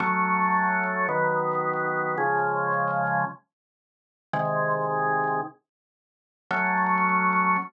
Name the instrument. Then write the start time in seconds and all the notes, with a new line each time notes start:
drawbar organ
0.00 F#3 A3 C#4
1.09 D#3 F#3 B3
2.18 C#3 F3 G#3
4.33 C3 D#3 G#3
6.51 F#3 A3 C#4